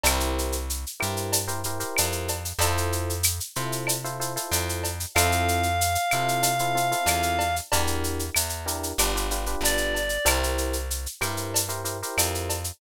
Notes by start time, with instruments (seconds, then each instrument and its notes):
0.04 electric bass (finger) C2, electric piano 1 E4 G4 A#4 C5, cowbell, claves, shaker
0.20 shaker
0.38 shaker
0.52 shaker
0.70 shaker
0.87 shaker
1.00 electric bass (finger) G2, electric piano 1 E4 G4 A#4 C5, claves, shaker
1.17 shaker
1.32 cowbell, shaker
1.48 electric piano 1 E4 G4 A#4 C5, shaker
1.64 electric piano 1 E4 G4 A#4 C5, shaker
1.80 electric piano 1 E4 G4 A#4 C5, shaker
1.97 electric bass (finger) F2, cowbell, claves, shaker
2.12 shaker
2.28 cowbell, shaker
2.45 shaker
2.59 electric bass (finger) F2, electric piano 1 E4 F4 A4 C5, cowbell, shaker
2.77 shaker
2.93 shaker
3.10 shaker
3.23 claves, shaker
3.40 shaker
3.56 electric bass (finger) C3, electric piano 1 E4 F4 A4 C5, shaker
3.72 shaker
3.87 cowbell, claves, shaker
4.04 electric piano 1 E4 F4 A4 C5, shaker
4.20 electric piano 1 E4 F4 A4 C5, shaker
4.36 electric piano 1 E4 F4 A4 C5, shaker
4.51 electric bass (finger) F2, cowbell, shaker
4.69 shaker
4.84 cowbell, shaker
5.00 shaker
5.15 electric bass (finger) F2, electric piano 1 C4 E4 F4 A4, clarinet F5, cowbell, claves, shaker
5.32 shaker
5.48 shaker
5.63 shaker
5.81 shaker
5.95 shaker
6.11 electric bass (finger) C3, electric piano 1 C4 E4 F4 A4, claves, shaker
6.28 shaker
6.43 cowbell, shaker
6.59 electric piano 1 C4 E4 F4 A4, shaker
6.75 electric piano 1 C4 E4 F4 A4, shaker
6.91 electric piano 1 C4 E4 F4 A4, shaker
7.06 electric bass (finger) E2, cowbell, claves, shaker
7.23 shaker
7.39 cowbell, shaker
7.56 shaker
7.72 electric bass (finger) E2, electric piano 1 D4 E4 G4 A#4, cowbell, shaker
7.87 shaker
8.04 shaker
8.19 shaker
8.35 electric bass (finger) E2, claves, shaker
8.49 shaker
8.66 electric piano 1 D4 E4 G4 A#4, shaker
8.83 shaker
8.98 electric bass (finger) G1, electric piano 1 D4 F4 G4 B4, cowbell, claves, shaker
9.15 electric piano 1 D4 F4 G4 B4, shaker
9.31 electric piano 1 D4 F4 G4 B4, shaker
9.46 electric piano 1 D4 F4 G4 B4, shaker
9.61 electric bass (finger) G1, clarinet D5, cowbell, shaker
9.78 shaker
9.95 cowbell, shaker
10.09 shaker
10.25 electric bass (finger) C2, electric piano 1 E4 G4 A#4 C5, cowbell, claves, shaker
10.43 shaker
10.58 shaker
10.73 shaker
10.91 shaker
11.06 shaker
11.21 electric bass (finger) G2, electric piano 1 E4 G4 A#4 C5, claves, shaker
11.37 shaker
11.54 cowbell, shaker
11.69 electric piano 1 E4 G4 A#4 C5, shaker
11.85 electric piano 1 E4 G4 A#4 C5, shaker
12.03 electric piano 1 E4 G4 A#4 C5, shaker
12.18 electric bass (finger) F2, cowbell, claves, shaker
12.35 shaker
12.50 cowbell, shaker
12.64 shaker